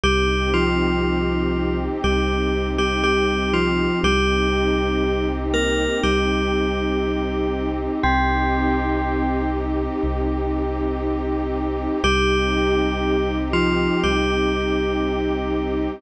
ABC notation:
X:1
M:4/4
L:1/16
Q:1/4=60
K:Cm
V:1 name="Tubular Bells"
[G,G]2 [F,F]6 [G,G]3 [G,G] [G,G]2 [F,F]2 | [G,G]6 [B,B]2 [G,G]8 | [C,C]6 z10 | [G,G]6 [F,F]2 [G,G]8 |]
V:2 name="Pad 2 (warm)"
[CEG]16 | [CEG]16 | [CEG]16 | [CEG]16 |]
V:3 name="Synth Bass 2" clef=bass
C,,8 C,,8 | C,,8 C,,8 | C,,8 C,,8 | C,,8 C,,8 |]